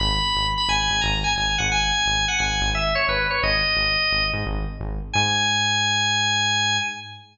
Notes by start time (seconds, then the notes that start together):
0.00 G#1 B5
0.35 G#1
0.58 B5
0.68 G#1 G#5
0.90 G#1
1.01 G#1 A#5
1.24 G#5
1.36 G#1 G#5
1.58 G#1 F#5
1.72 G#5
2.06 G#1
2.28 F#5
2.39 G#1 G#5
2.61 G#1
2.75 E5
2.95 C#5
3.08 G#1 B4
3.30 C#5
3.43 G#1 D#5
3.77 G#1
4.11 G#1
4.33 G#2
4.46 G#1
4.80 G#1
5.13 G#2 G#5